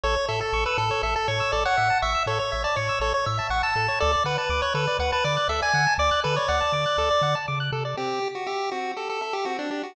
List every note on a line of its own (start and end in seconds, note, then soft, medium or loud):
0.03 0.17 A1 loud
0.03 0.15 A4 loud
0.03 0.26 C#5 loud
0.16 0.27 C#5 loud
0.28 0.42 A2 medium
0.28 0.40 A4 loud
0.28 0.40 E5 loud
0.40 0.64 A4 loud
0.40 0.52 A5 loud
0.53 0.66 A1 loud
0.53 0.64 C#6 loud
0.66 0.77 B4 loud
0.66 0.77 E6 loud
0.78 0.91 A2 loud
0.78 1.02 A4 loud
0.78 0.89 A4 loud
0.91 1.02 C#5 loud
1.03 1.16 A1 loud
1.03 1.15 A4 loud
1.03 1.14 E5 loud
1.15 1.28 A4 loud
1.15 1.27 A5 loud
1.28 1.42 A2 loud
1.28 1.52 C#5 loud
1.28 1.39 C#6 loud
1.40 1.51 E6 loud
1.52 1.67 A1 medium
1.52 1.64 A4 loud
1.52 1.64 D5 loud
1.65 1.76 C#5 loud
1.65 1.98 F#5 loud
1.77 1.91 A2 medium
1.77 1.88 E5 loud
1.90 2.01 A5 loud
2.02 2.16 A1 loud
2.02 2.23 E5 loud
2.02 2.13 C#6 loud
2.15 2.26 E6 medium
2.26 2.40 A2 medium
2.26 2.38 A4 loud
2.26 2.39 C#5 loud
2.39 2.63 C#5 loud
2.39 2.51 C#5 loud
2.52 2.67 A1 medium
2.52 2.63 E5 loud
2.64 2.76 D5 loud
2.64 2.75 A5 loud
2.76 2.90 A2 medium
2.76 2.99 C#5 loud
2.76 2.88 C#6 loud
2.89 3.00 E6 medium
3.00 3.14 A1 loud
3.00 3.13 A4 loud
3.00 3.13 C#5 loud
3.14 3.25 C#5 loud
3.14 3.26 C#5 loud
3.26 3.40 A2 loud
3.26 3.47 E5 loud
3.26 3.37 E5 loud
3.39 3.50 A5 loud
3.50 3.63 A1 loud
3.50 3.62 F#5 loud
3.50 3.62 C#6 loud
3.63 3.99 A5 loud
3.63 3.75 E6 loud
3.76 3.89 A2 medium
3.76 3.87 A4 loud
3.88 3.99 C#5 loud
4.00 4.16 D2 loud
4.00 4.12 A4 loud
4.00 4.23 D5 loud
4.13 4.24 D5 loud
4.24 4.38 D3 medium
4.24 4.37 B4 loud
4.24 4.37 F#5 loud
4.38 4.61 B4 loud
4.38 4.49 A5 loud
4.49 4.63 D2 loud
4.49 4.61 D6 loud
4.62 4.74 C#5 loud
4.62 4.74 F#6 loud
4.74 4.88 D3 loud
4.74 4.86 A4 loud
4.74 4.97 B4 loud
4.87 4.98 D5 loud
4.99 5.13 D2 loud
4.99 5.11 B4 loud
4.99 5.11 F#5 loud
5.12 5.24 B4 loud
5.12 5.23 A5 loud
5.24 5.38 D3 loud
5.24 5.48 D5 loud
5.24 5.35 D6 loud
5.37 5.48 F#6 loud
5.48 5.62 D2 medium
5.48 5.61 A4 loud
5.48 5.61 E5 loud
5.62 5.73 D5 loud
5.62 5.94 G#5 loud
5.74 5.87 D3 loud
5.74 5.85 F#5 loud
5.87 5.98 A5 loud
5.98 6.12 D2 loud
5.98 6.20 D5 loud
5.98 6.10 D6 loud
6.11 6.22 F#6 loud
6.24 6.39 D3 loud
6.24 6.35 A4 loud
6.24 6.36 B4 loud
6.36 6.48 C#5 loud
6.36 6.47 D5 loud
6.48 6.63 D2 loud
6.48 7.35 D5 loud
6.48 6.60 F#5 loud
6.61 6.72 A5 loud
6.72 6.86 D3 medium
6.72 6.84 D6 loud
6.86 6.97 F#6 loud
6.98 7.11 D2 medium
6.98 7.09 A4 loud
7.11 7.22 D5 loud
7.21 7.35 D3 loud
7.21 7.34 F#5 medium
7.35 7.46 A5 loud
7.48 7.71 C#3 loud
7.48 7.59 D6 loud
7.60 7.71 F#6 loud
7.72 7.95 C3 loud
7.72 7.84 A4 loud
7.85 7.96 D5 loud
7.97 8.20 C4 medium
7.97 8.28 G4 loud
8.22 8.44 G4 medium
8.35 8.47 F#4 medium
8.47 8.70 G4 loud
8.47 8.69 E5 medium
8.71 8.94 C4 medium
8.71 8.92 F#4 loud
8.96 9.19 G4 medium
8.96 9.08 A4 medium
9.09 9.21 A4 loud
9.21 9.34 A4 medium
9.21 9.43 E5 medium
9.33 9.45 G4 loud
9.45 9.68 C4 medium
9.45 9.57 F#4 loud
9.59 9.70 D4 loud
9.71 9.82 D4 medium
9.71 9.93 G4 medium
9.83 9.95 F#4 medium